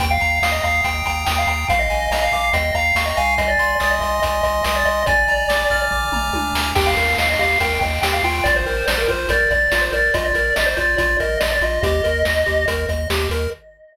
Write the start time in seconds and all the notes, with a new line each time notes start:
0.00 D#2 G5, kick, closed hi-hat
0.11 F5
0.20 D#2 A#5, closed hi-hat
0.42 D#2 F5 D#6, snare
0.51 D#5
0.63 D#2 F5 A#5, kick, closed hi-hat
0.84 D#2 G5, kick, closed hi-hat
1.05 D#2 G5 A#5, kick, closed hi-hat
1.26 D#2 G5 D#6, snare
1.38 F5
1.47 D#2 G5 A#5, closed hi-hat
1.68 A#1 F5, kick, closed hi-hat
1.79 D#5
1.90 A#1 G#5, closed hi-hat
2.11 A#1 D#5 A#5, snare
2.23 F5
2.32 A#1 F5 D6, kick, closed hi-hat
2.53 D#2 D#5 G5, kick, closed hi-hat
2.74 D#2 F5 A#5, kick, closed hi-hat
2.95 D#2 F5 C#6, snare
3.06 D#5
3.17 C2 F5 G#5, closed hi-hat
3.38 D#5, kick, closed hi-hat
3.48 D5
3.58 C2 C6, closed hi-hat
3.80 C2 D5 D#6, snare
3.90 D#5
4.01 C2 D#5 C6, kick, closed hi-hat
4.22 C2 D#5 G#5, kick, closed hi-hat
4.43 C2 D#5 C6, kick, closed hi-hat
4.64 C2 D#5 D#6, snare
4.76 D5
4.85 C2 D#5 C6, closed hi-hat
5.06 A#1 D5 G#5, kick, closed hi-hat
5.28 A#1 A#5, closed hi-hat
5.48 A#1 D6, snare
5.70 A#1 F6, kick, closed hi-hat
5.91 A#1 D6, kick, floor tom
6.12 A#1 A#5, mid tom
6.33 C#2 G#5, high tom
6.53 D2 A#5, snare
6.75 D#2 G4 G5, kick, crash
6.87 F5
6.97 D#2 A#4, closed hi-hat
7.18 D#2 D#5 F5, snare
7.30 D#5
7.39 D#2 G4 F5, kick, closed hi-hat
7.60 D#2 A#4 G5, kick, closed hi-hat
7.81 D#2 D#5 G5, kick, closed hi-hat
8.02 D#2 G4 G5, snare
8.13 F5
8.23 D#2 F4 G5, open hi-hat
8.44 A#1 D5, kick, closed hi-hat
8.56 C5
8.66 A#1 A#4, closed hi-hat
8.87 A#1 C5 D5, snare
8.98 A#4
9.08 A#1 F4 C5, kick, closed hi-hat
9.29 A#1 A#4 D5, kick, closed hi-hat
9.51 A#1 D5, kick, closed hi-hat
9.72 A#1 F4 D5, snare
9.81 C5
9.92 A#1 A#4 D5, closed hi-hat
10.14 A#1 F4 D#5, kick, closed hi-hat
10.25 D5
10.35 A#1 A#4, closed hi-hat
10.56 A#1 D5 D#5, snare
10.66 C5
10.77 A#1 F4 D5, kick, closed hi-hat
10.98 A#1 F4 D5, kick, closed hi-hat
11.19 A#1 A#4 D#5, kick, closed hi-hat
11.40 A#1 D5 D#5, snare
11.52 D5
11.61 A#1 F4 D#5, closed hi-hat
11.83 D#2 G4 D#5, kick, closed hi-hat
12.04 D#2 A#4, closed hi-hat
12.25 D#2 D#5, snare
12.46 D#2 G4, kick, closed hi-hat
12.68 D#2 A#4, kick, closed hi-hat
12.88 D#2 D#5, kick, closed hi-hat
13.10 D#2 G4, snare
13.30 D#2 A#4, closed hi-hat